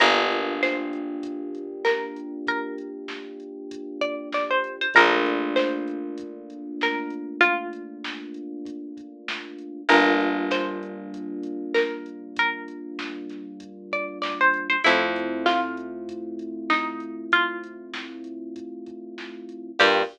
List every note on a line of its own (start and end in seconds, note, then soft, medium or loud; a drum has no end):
0.00 4.57 G1 loud
0.00 4.86 A#3 medium
0.00 4.86 D4 medium
0.00 4.86 F4 medium
0.00 4.86 G4 medium
0.00 0.61 A#4 medium
0.00 kick medium
0.00 closed hi-hat medium
0.32 closed hi-hat medium
0.63 1.75 C5 medium
0.63 snare medium
0.93 closed hi-hat medium
1.23 kick medium
1.23 closed hi-hat loud
1.55 closed hi-hat medium
1.84 2.38 A#4 medium
1.84 snare loud
2.16 closed hi-hat medium
2.47 3.52 A#4 medium
2.47 kick medium
2.47 closed hi-hat medium
2.78 closed hi-hat medium
3.08 snare medium
3.40 closed hi-hat medium
3.71 kick medium
3.71 closed hi-hat loud
4.01 4.29 D5 medium
4.01 kick medium
4.01 closed hi-hat medium
4.32 4.50 D5 medium
4.32 snare medium
4.50 4.76 C5 medium
4.64 closed hi-hat medium
4.81 4.94 C5 medium
4.94 9.53 A#1 medium
4.94 9.81 A3 medium
4.94 9.81 A#3 loud
4.94 9.81 D4 medium
4.94 9.81 F4 medium
4.94 5.53 A#4 loud
4.94 kick medium
4.94 closed hi-hat medium
5.26 closed hi-hat medium
5.56 6.60 C5 medium
5.56 snare loud
5.88 closed hi-hat medium
6.18 kick medium
6.18 closed hi-hat medium
6.50 closed hi-hat medium
6.81 7.35 A#4 medium
6.81 snare medium
7.10 closed hi-hat medium
7.41 8.43 F4 loud
7.41 kick medium
7.41 closed hi-hat medium
7.73 closed hi-hat medium
8.04 snare loud
8.34 closed hi-hat medium
8.65 kick medium
8.65 closed hi-hat medium
8.97 kick medium
8.97 closed hi-hat medium
9.28 snare loud
9.59 closed hi-hat medium
9.89 14.45 G1 medium
9.89 14.76 G3 loud
9.89 14.76 A#3 loud
9.89 14.76 D4 medium
9.89 14.76 F4 medium
9.89 10.41 A#4 medium
9.89 kick medium
9.89 closed hi-hat medium
10.20 closed hi-hat medium
10.51 11.71 C5 medium
10.51 snare loud
10.83 closed hi-hat medium
11.14 kick medium
11.14 closed hi-hat medium
11.43 closed hi-hat medium
11.74 12.34 A#4 medium
11.74 snare loud
12.06 closed hi-hat medium
12.36 13.41 A#4 medium
12.36 kick medium
12.36 closed hi-hat loud
12.68 closed hi-hat medium
12.99 snare medium
13.30 snare soft
13.30 closed hi-hat medium
13.60 kick medium
13.60 closed hi-hat medium
13.92 14.18 D5 medium
13.92 kick medium
13.92 closed hi-hat medium
14.22 14.38 D5 medium
14.22 snare loud
14.40 14.67 C5 medium
14.54 closed hi-hat medium
14.69 14.82 C5 medium
14.84 19.43 F2 medium
14.84 19.70 A3 medium
14.84 19.70 C4 medium
14.84 19.70 E4 medium
14.84 15.44 E4 medium
14.84 19.70 F4 medium
14.84 kick medium
14.84 closed hi-hat loud
15.16 closed hi-hat medium
15.46 16.46 F4 medium
15.46 snare loud
15.77 closed hi-hat medium
16.09 kick medium
16.09 closed hi-hat medium
16.39 closed hi-hat medium
16.70 17.24 D#4 medium
16.70 snare medium
17.00 closed hi-hat medium
17.32 18.19 F4 medium
17.32 kick medium
17.32 closed hi-hat medium
17.64 closed hi-hat medium
17.94 snare loud
18.24 closed hi-hat medium
18.56 kick medium
18.56 closed hi-hat medium
18.86 kick medium
18.86 closed hi-hat medium
19.18 snare medium
19.49 closed hi-hat medium
19.79 20.03 G2 loud
19.79 20.02 A#3 loud
19.79 20.02 D4 medium
19.79 20.02 F4 loud
19.79 20.02 G4 medium
19.79 20.02 G4 loud
19.79 kick loud
19.79 crash loud